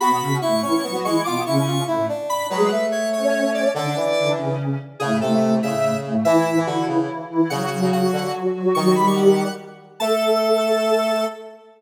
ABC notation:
X:1
M:6/8
L:1/16
Q:3/8=96
K:Emix
V:1 name="Lead 1 (square)"
b4 c'2 c'4 c'2 | d'2 c'4 z4 b2 | B4 c2 c4 d2 | d6 z6 |
[K:Amix] ^G2 A4 e4 z2 | e4 F2 z6 | f4 f4 z4 | c' c' b c' f4 z4 |
a12 |]
V:2 name="Ocarina"
[B,,B,]2 [C,C]2 [A,,A,]2 [E,E]2 [F,F] [F,F] [E,E]2 | [B,,B,]2 [C,C]4 [A,,A,]2 z4 | [G,G]2 z4 [Cc]6 | [D,D]2 z2 [D,D]2 [C,C]4 z2 |
[K:Amix] [A,,A,]2 [A,,A,]8 [A,,A,]2 | [E,E]2 [E,E]8 [E,E]2 | [F,F]2 [F,F]8 [F,F]2 | [F,F]2 [G,G]6 z4 |
A12 |]
V:3 name="Brass Section"
F4 E2 C2 B, B, G,2 | =F2 E E F2 E2 D4 | F,2 A,10 | D,2 E,6 z4 |
[K:Amix] C,2 ^B,,4 C,6 | E,3 E, D,2 C,2 z4 | C,3 C, C,2 D,2 z4 | ^D,8 z4 |
A,12 |]